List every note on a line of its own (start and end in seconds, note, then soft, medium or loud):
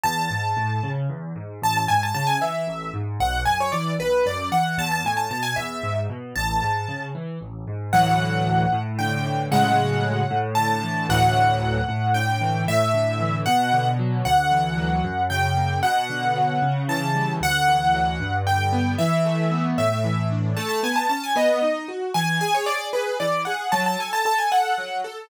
0.04 0.28 E2 medium
0.04 0.89 A5 medium
0.31 0.54 G#2 medium
0.57 0.80 A2 medium
0.83 1.07 C#3 medium
1.10 1.33 E2 medium
1.36 1.60 G#2 medium
1.62 1.86 A1 medium
1.62 1.76 A5 medium
1.77 1.90 A5 medium
1.88 2.12 G#2 medium
1.88 2.01 G#5 medium
2.03 2.14 A5 medium
2.15 2.38 C#3 medium
2.15 2.27 A5 medium
2.27 2.39 G#5 medium
2.41 2.65 E3 medium
2.41 2.91 E5 medium
2.67 2.91 A1 medium
2.94 3.18 G#2 medium
3.20 3.44 B1 medium
3.20 3.42 F#5 medium
3.46 3.70 F#2 medium
3.46 3.58 G#5 medium
3.61 3.73 C#5 medium
3.72 3.96 E3 medium
3.72 3.93 D5 medium
3.99 4.23 B1 medium
3.99 4.25 B4 medium
4.25 4.49 F#2 medium
4.25 4.49 D5 medium
4.52 4.75 E3 medium
4.52 4.76 F#5 medium
4.78 5.02 E2 medium
4.78 4.91 A5 medium
4.92 5.04 A5 medium
5.04 5.28 A2 medium
5.04 5.19 G#5 medium
5.17 5.29 A5 medium
5.30 5.54 B2 medium
5.30 5.44 A5 medium
5.43 5.55 G#5 medium
5.56 5.81 E2 medium
5.56 5.99 E5 medium
5.83 6.07 G#2 medium
6.10 6.33 B2 medium
6.36 6.60 A1 medium
6.36 7.03 A5 medium
6.62 6.86 G#2 medium
6.88 7.12 C#3 medium
7.15 7.39 E3 medium
7.41 7.65 A1 medium
7.67 7.91 G#2 medium
7.93 8.65 D2 medium
7.93 8.65 A2 medium
7.93 8.65 E3 medium
7.93 8.65 F#3 medium
7.93 8.80 F#5 medium
8.73 9.48 A2 medium
8.99 9.49 D3 medium
8.99 9.42 G5 medium
9.25 9.50 E3 medium
9.52 10.23 A2 medium
9.52 10.23 C#3 medium
9.52 10.23 F#3 medium
9.52 10.23 G#3 medium
9.52 10.38 F#5 medium
10.30 11.05 A2 medium
10.55 11.07 D3 medium
10.55 11.06 A5 medium
10.83 11.08 E3 medium
11.09 11.80 D2 medium
11.09 11.80 A2 medium
11.09 11.80 E3 medium
11.09 11.80 F#3 medium
11.09 12.13 F#5 medium
11.88 12.63 A2 medium
12.14 12.65 D3 medium
12.14 12.62 G5 medium
12.41 12.66 E3 medium
12.67 13.42 A2 medium
12.67 13.37 E5 medium
12.94 13.44 D3 medium
13.20 13.45 E3 medium
13.46 14.21 B2 medium
13.46 13.89 F#5 medium
13.73 14.23 D3 medium
13.99 14.24 F#3 medium
14.25 15.00 D2 medium
14.25 15.23 F#5 medium
14.52 15.02 E3 medium
14.78 15.03 F#3 medium
15.04 15.79 F#2 medium
15.30 15.81 C#3 medium
15.30 15.79 G5 medium
15.57 15.82 A#3 medium
15.83 16.58 B2 medium
15.83 16.81 F#5 medium
16.10 16.60 D3 medium
16.36 16.61 F#3 medium
16.62 17.37 C#3 medium
16.88 17.38 E3 medium
16.88 17.32 A5 medium
17.15 17.40 G3 medium
17.41 18.16 D2 medium
17.41 18.36 F#5 loud
17.67 18.17 E3 medium
17.94 18.19 F#3 medium
18.20 18.95 G2 medium
18.46 18.96 D3 medium
18.46 18.92 G5 medium
18.73 18.98 B3 medium
18.98 19.74 E3 medium
18.98 19.65 E5 medium
19.25 19.75 A3 medium
19.52 19.77 B3 medium
19.78 20.53 A2 medium
19.78 20.27 E5 medium
20.04 20.54 E3 medium
20.31 20.56 D4 medium
20.57 20.81 A3 medium
20.57 20.68 A5 medium
20.69 20.81 A5 medium
20.83 21.07 B3 medium
20.83 20.96 G#5 medium
20.96 21.08 A5 medium
21.09 21.33 C#4 medium
21.09 21.22 A5 medium
21.24 21.36 G#5 medium
21.36 21.59 B3 medium
21.36 21.87 D#5 medium
21.62 21.86 D#4 medium
21.88 22.12 F#4 medium
22.14 22.38 E3 medium
22.14 22.38 G#5 medium
22.41 22.65 G#4 medium
22.41 22.53 G#5 medium
22.54 22.67 C#5 medium
22.66 22.91 G#4 medium
22.66 22.88 D5 medium
22.93 23.17 G#4 medium
22.93 23.17 B4 medium
23.20 23.44 E3 medium
23.20 23.42 D5 medium
23.45 23.70 G#4 medium
23.45 23.70 F#5 medium
23.72 23.96 F#3 medium
23.72 23.84 A5 medium
23.86 23.99 A5 medium
23.99 24.23 A4 medium
23.99 24.13 G#5 medium
24.13 24.25 A5 medium
24.25 24.49 A4 medium
24.25 24.38 A5 medium
24.38 24.51 G#5 medium
24.52 24.75 A4 medium
24.52 25.00 F#5 medium
24.78 25.02 F#3 medium
25.04 25.28 A4 medium